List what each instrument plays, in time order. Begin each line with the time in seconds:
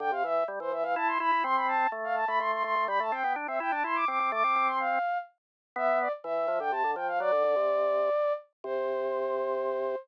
0.00 drawbar organ D3, flute G5
0.12 drawbar organ C3, flute F5
0.24 drawbar organ E3, flute E5
0.48 drawbar organ G3
0.60 drawbar organ E3, flute C5
0.72 drawbar organ E3, flute E5
0.83 drawbar organ E3, flute F5
0.96 drawbar organ E4, flute A5
1.07 flute C6
1.20 drawbar organ E4, flute B5
1.32 drawbar organ E4
1.44 drawbar organ C4, flute C6
1.56 flute B5
1.67 flute A5
1.92 drawbar organ A3
2.04 flute F5
2.15 flute A5
2.27 drawbar organ A3, flute B5
2.40 drawbar organ A3, flute C6
2.52 flute C6
2.64 drawbar organ A3, flute C6
2.76 drawbar organ A3
2.88 drawbar organ G3, flute B5
3.00 drawbar organ A3, flute A5
3.12 drawbar organ C4, flute G5
3.24 drawbar organ B3
3.36 drawbar organ D4
3.47 drawbar organ C4, flute E5
3.60 drawbar organ E4, flute G5
3.71 drawbar organ D4, flute A5
3.84 drawbar organ E4, flute C6
3.95 flute D6
4.08 drawbar organ C4, flute D6
4.20 drawbar organ C4
4.32 drawbar organ A3, flute D6
4.44 drawbar organ C4
4.56 drawbar organ C4
4.67 flute C6
4.80 flute F5
5.76 drawbar organ B3, flute E5
6.01 flute D5
6.24 drawbar organ E3, flute E5
6.48 drawbar organ F3
6.60 drawbar organ D3, flute G5
6.72 drawbar organ C3, flute A5
6.84 drawbar organ D3
6.96 drawbar organ F3, flute G5
7.08 flute F5
7.20 drawbar organ F#3, flute D5
7.32 drawbar organ D3
7.44 drawbar organ D3
7.56 drawbar organ C3
8.64 drawbar organ C3, flute C5